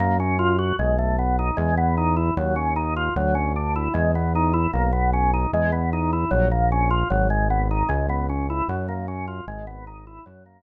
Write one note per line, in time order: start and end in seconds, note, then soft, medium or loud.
0.00 0.73 F#2 loud
0.00 0.17 A#3 medium
0.20 0.38 C#4 medium
0.39 0.57 F4 medium
0.59 0.76 F#4 medium
0.79 1.51 B1 loud
0.79 0.97 G#3 medium
0.99 1.16 A3 medium
1.19 1.36 B3 medium
1.39 1.57 D#4 medium
1.57 2.31 E2 loud
1.57 1.75 G#3 medium
1.77 1.95 B3 medium
1.97 2.15 D#4 medium
2.17 2.34 E4 medium
2.37 3.10 D#2 loud
2.37 2.55 F#3 medium
2.56 2.74 C#4 medium
2.76 2.94 D#4 medium
2.96 3.14 F4 medium
3.16 3.88 D2 loud
3.16 3.34 F#3 medium
3.35 3.53 C#4 medium
3.56 3.74 D4 medium
3.76 3.93 E4 medium
3.94 4.67 E2 loud
3.94 4.12 G#3 medium
4.15 4.33 B3 medium
4.35 4.53 D#4 medium
4.53 4.71 E4 medium
4.73 5.46 B1 loud
4.73 4.91 A#3 medium
4.93 5.10 B3 medium
5.13 5.31 C#4 medium
5.34 5.51 D#4 medium
5.53 6.25 E2 loud
5.53 5.71 G#3 medium
5.72 5.90 B3 medium
5.93 6.11 D#4 medium
6.13 6.30 E4 medium
6.31 7.04 A#1 loud
6.31 6.49 F#3 medium
6.51 6.69 A#3 medium
6.72 6.90 C#4 medium
6.91 7.08 F4 medium
7.10 7.83 G#1 loud
7.10 7.28 F#3 medium
7.30 7.48 G#3 medium
7.50 7.68 B3 medium
7.71 7.89 D#4 medium
7.89 8.62 C#2 loud
7.89 8.06 G#3 medium
8.09 8.27 B3 medium
8.29 8.47 C#4 medium
8.50 8.68 E4 medium
8.68 9.41 F#2 loud
8.68 8.87 F#3 medium
8.88 9.06 A#3 medium
9.08 9.26 C#4 medium
9.28 9.45 F4 medium
9.47 10.20 G#1 loud
9.47 9.66 G#3 medium
9.67 9.85 B3 medium
9.87 10.05 D#4 medium
10.07 10.25 E4 medium
10.26 10.62 F#2 loud
10.26 10.44 F#3 medium
10.46 10.62 A#3 medium